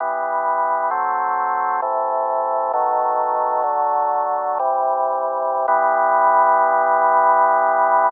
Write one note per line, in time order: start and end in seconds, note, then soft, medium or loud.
0.00 0.90 E3 medium
0.00 0.90 G3 medium
0.00 0.90 B3 medium
0.91 1.81 F#3 medium
0.91 1.81 A3 medium
0.91 1.81 C4 medium
1.82 2.72 C3 medium
1.82 2.72 E3 medium
1.82 2.72 A3 medium
2.73 3.63 B2 medium
2.73 3.63 D#3 medium
2.73 3.63 F#3 medium
2.73 3.63 A3 medium
3.63 4.58 D3 medium
3.63 4.58 F#3 medium
3.63 4.58 A3 medium
4.59 5.66 C3 medium
4.59 5.66 E3 medium
4.59 5.66 G3 medium
5.68 8.09 E3 loud
5.68 8.09 G3 loud
5.68 8.09 B3 loud